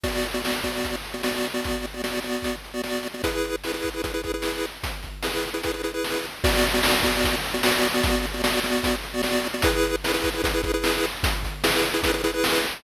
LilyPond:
<<
  \new Staff \with { instrumentName = "Lead 1 (square)" } { \time 4/4 \key a \major \tempo 4 = 150 <b fis' d''>8. <b fis' d''>16 <b fis' d''>8 <b fis' d''>4~ <b fis' d''>16 <b fis' d''>16 <b fis' d''>8. <b fis' d''>16~ | <b fis' d''>8. <b fis' d''>16 <b fis' d''>8 <b fis' d''>4~ <b fis' d''>16 <b fis' d''>16 <b fis' d''>8. <b fis' d''>16 | <e' gis' b'>4 <e' gis' b'>16 <e' gis' b'>8 <e' gis' b'>16 <e' gis' b'>16 <e' gis' b'>16 <e' gis' b'>16 <e' gis' b'>4~ <e' gis' b'>16~ | <e' gis' b'>4 <e' gis' b'>16 <e' gis' b'>8 <e' gis' b'>16 <e' gis' b'>16 <e' gis' b'>16 <e' gis' b'>16 <e' gis' b'>4~ <e' gis' b'>16 |
<b fis' d''>8. <b fis' d''>16 <b fis' d''>8 <b fis' d''>4~ <b fis' d''>16 <b fis' d''>16 <b fis' d''>8. <b fis' d''>16~ | <b fis' d''>8. <b fis' d''>16 <b fis' d''>8 <b fis' d''>4~ <b fis' d''>16 <b fis' d''>16 <b fis' d''>8. <b fis' d''>16 | <e' gis' b'>4 <e' gis' b'>16 <e' gis' b'>8 <e' gis' b'>16 <e' gis' b'>16 <e' gis' b'>16 <e' gis' b'>16 <e' gis' b'>4~ <e' gis' b'>16~ | <e' gis' b'>4 <e' gis' b'>16 <e' gis' b'>8 <e' gis' b'>16 <e' gis' b'>16 <e' gis' b'>16 <e' gis' b'>16 <e' gis' b'>4~ <e' gis' b'>16 | }
  \new DrumStaff \with { instrumentName = "Drums" } \drummode { \time 4/4 <cymc bd>8 hh8 sn8 <hh bd>8 <hh bd>8 hh8 sn8 hho8 | <hh bd>8 hh8 sn8 hh8 <hh bd>8 hh8 sn8 hh8 | <hh bd>8 hh8 sn8 <hh bd>8 <hh bd>8 <hh bd>8 sn8 hh8 | <hh bd>8 <hh bd>8 sn8 hh8 <hh bd>8 hh8 sn8 hh8 |
<cymc bd>8 hh8 sn8 <hh bd>8 <hh bd>8 hh8 sn8 hho8 | <hh bd>8 hh8 sn8 hh8 <hh bd>8 hh8 sn8 hh8 | <hh bd>8 hh8 sn8 <hh bd>8 <hh bd>8 <hh bd>8 sn8 hh8 | <hh bd>8 <hh bd>8 sn8 hh8 <hh bd>8 hh8 sn8 hh8 | }
>>